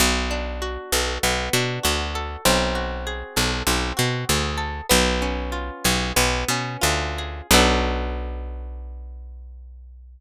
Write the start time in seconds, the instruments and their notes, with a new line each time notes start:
0.00 electric bass (finger) B1, acoustic guitar (steel) B3
0.31 acoustic guitar (steel) D4
0.62 acoustic guitar (steel) F#4
0.92 electric bass (finger) B1, acoustic guitar (steel) A4
1.23 electric bass (finger) B1, acoustic guitar (steel) B3
1.53 electric bass (finger) B2, acoustic guitar (steel) D4
1.83 electric bass (finger) D2, acoustic guitar (steel) F#4
2.15 acoustic guitar (steel) A4
2.45 electric bass (finger) B1, acoustic guitar (steel) C4
2.75 acoustic guitar (steel) F#4
3.07 acoustic guitar (steel) G#4
3.36 electric bass (finger) B1, acoustic guitar (steel) A4
3.67 electric bass (finger) B1, acoustic guitar (steel) C4
3.97 electric bass (finger) B2, acoustic guitar (steel) F#4
4.29 electric bass (finger) D2, acoustic guitar (steel) G#4
4.58 acoustic guitar (steel) A4
4.89 electric bass (finger) B1, acoustic guitar (steel) B3
5.22 acoustic guitar (steel) C#4
5.52 acoustic guitar (steel) F4
5.84 electric bass (finger) B1, acoustic guitar (steel) G#4
6.16 electric bass (finger) B1, acoustic guitar (steel) B3
6.48 electric bass (finger) B2, acoustic guitar (steel) C#4
6.81 electric bass (finger) D2, acoustic guitar (steel) F4
7.18 acoustic guitar (steel) G#4
7.51 electric bass (finger) B1, acoustic guitar (steel) B3 D4 F#4 A4